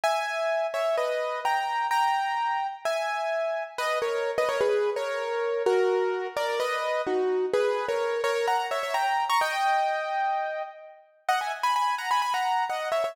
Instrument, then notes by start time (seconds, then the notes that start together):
acoustic grand piano
0.04 E5 G#5
0.74 C#5 E5
0.97 B4 D#5
1.45 G5 A#5
1.91 G5 A#5
2.85 E5 G#5
3.78 B4 D#5
4.02 A#4 C#5
4.38 B4 D#5
4.49 A#4 C#5
4.61 G#4 B4
4.96 A#4 C#5
5.66 F#4 A#4
6.37 A#4 D5
6.60 B4 D#5
7.07 D#4 F#4
7.54 G#4 B4
7.88 A#4 C#5
8.24 A#4 C#5
8.47 F#5 A#5
8.71 C#5 E5
8.83 C#5 E5
8.94 G5 A#5
9.29 A#5 C#6
9.41 D#5 G5
11.29 D#5 F#5
11.41 E5 G#5
11.63 G#5 B5
11.76 G#5 B5
11.98 F#5 A#5
12.11 G#5 B5
12.22 G#5 B5
12.34 F#5 A#5
12.70 D#5 F#5
12.92 C#5 E5
13.04 C#5 E5